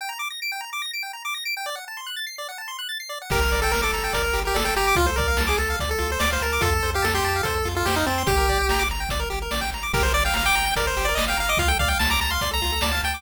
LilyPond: <<
  \new Staff \with { instrumentName = "Lead 1 (square)" } { \time 4/4 \key g \minor \tempo 4 = 145 r1 | r1 | bes'8. a'16 bes'16 a'8. bes'8. g'16 a'16 a'16 g'8 | f'16 c''16 bes'8. gis'16 a'8 r16 a'8 c''16 d''16 c''16 bes'8 |
a'8. g'16 a'16 g'8. a'8. f'16 g'16 ees'16 c'8 | g'4. r2 r8 | bes'16 c''16 d''16 f''16 f''16 g''8. bes'16 c''8 d''16 ees''16 f''16 f''16 ees''16 | f''16 g''16 f''16 g''16 a''16 bes''16 bes''16 c'''8 bes''8. a''16 a''16 g''8 | }
  \new Staff \with { instrumentName = "Lead 1 (square)" } { \time 4/4 \key g \minor g''16 bes''16 d'''16 bes'''16 d''''16 g''16 bes''16 d'''16 bes'''16 d''''16 g''16 bes''16 d'''16 bes'''16 d''''16 g''16 | d''16 fis''16 a''16 c'''16 fis'''16 a'''16 c''''16 d''16 fis''16 a''16 c'''16 fis'''16 a'''16 c''''16 d''16 fis''16 | g'16 bes'16 d''16 g''16 bes''16 d'''16 bes''16 g''16 d''16 bes'16 g'16 bes'16 d''16 g''16 bes''16 d'''16 | f'16 a'16 d''16 f''16 a''16 d'''16 a''16 f''16 d''16 a'16 f'16 a'16 d''16 f''16 a''16 d'''16 |
f'16 a'16 c''16 f''16 a''16 c'''16 a''16 f''16 c''16 a'16 f'16 a'16 c''16 f''16 a''16 c'''16 | g'16 bes'16 d''16 g''16 bes''16 d'''16 bes''16 g''16 d''16 bes'16 g'16 bes'16 d''16 g''16 bes''16 d'''16 | g'16 bes'16 d''16 g''16 bes''16 d'''16 bes''16 g''16 d''16 bes'16 g'16 bes'16 d''16 g''16 bes''16 d'''16 | f'16 a'16 d''16 f''16 a''16 d'''16 a''16 f''16 d''16 a'16 f'16 a'16 d''16 f''16 a''16 d'''16 | }
  \new Staff \with { instrumentName = "Synth Bass 1" } { \clef bass \time 4/4 \key g \minor r1 | r1 | g,,8 g,,8 g,,8 g,,8 g,,8 g,,8 g,,8 g,,8 | d,8 d,8 d,8 d,8 d,8 d,8 d,8 d,8 |
f,8 f,8 f,8 f,8 f,8 f,8 f,8 f,8 | g,,8 g,,8 g,,8 g,,8 g,,8 g,,8 a,,8 aes,,8 | g,,8 g,,8 g,,8 g,,8 g,,8 g,,8 g,,8 g,,8 | d,8 d,8 d,8 d,8 d,8 d,8 d,8 d,8 | }
  \new DrumStaff \with { instrumentName = "Drums" } \drummode { \time 4/4 r4 r4 r4 r4 | r4 r4 r4 r4 | <cymc bd>8 hh8 sn8 hh8 <hh bd>8 hh8 sn8 hh8 | <hh bd>8 <hh bd>8 sn8 hh8 <hh bd>8 hh8 sn8 hh8 |
<hh bd>8 hh8 sn8 hh8 <hh bd>8 hh8 sn8 hh8 | <hh bd>8 <hh bd>8 sn8 hh8 <hh bd>8 hh8 sn8 hh8 | <cymc bd>8 hh8 sn8 hh8 <hh bd>8 hh8 sn8 hh8 | <hh bd>8 <hh bd>8 sn8 hh8 <hh bd>8 hh8 sn8 hh8 | }
>>